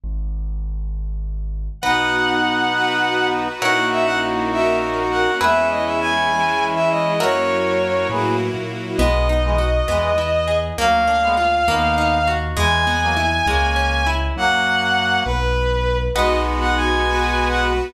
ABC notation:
X:1
M:6/8
L:1/16
Q:3/8=67
K:B
V:1 name="Violin"
z12 | f12 | f2 e f z2 e2 z2 f2 | e2 d e g5 e d2 |
c6 z6 | d12 | ^e12 | g12 |
f6 B6 | d2 z f g5 f z2 |]
V:2 name="Brass Section"
z12 | [B,D]12 | [DF]12 | [CE]12 |
[FA]6 [GB]2 z4 | [G,B,]2 z [E,G,] z2 [E,G,]2 z4 | [F,A,]2 z [G,B,] z2 [B,D]4 z2 | [E,G,]2 z [F,A,] z2 [A,C]4 z2 |
[F,A,]6 z6 | [G,B,]12 |]
V:3 name="Orchestral Harp"
z12 | [Bdf]12 | [Acef]12 | [GBe]12 |
[FAce]12 | B,2 D2 F2 B,2 E2 G2 | A,2 =D2 ^E2 A,2 ^D2 F2 | G,2 B,2 E2 G,2 C2 E2 |
z12 | [Bdf]12 |]
V:4 name="Acoustic Grand Piano" clef=bass
G,,,12 | B,,,12 | A,,,12 | E,,12 |
F,,6 =A,,3 ^A,,3 | B,,,6 E,,6 | =D,,6 ^D,,6 | E,,6 C,,6 |
F,,6 B,,,6 | B,,,12 |]
V:5 name="String Ensemble 1"
z12 | [B,DF]6 [B,FB]6 | [A,CEF]6 [A,CFA]6 | [G,B,E]6 [E,G,E]6 |
[F,A,CE]6 [F,A,EF]6 | z12 | z12 | z12 |
z12 | [B,DF]6 [B,FB]6 |]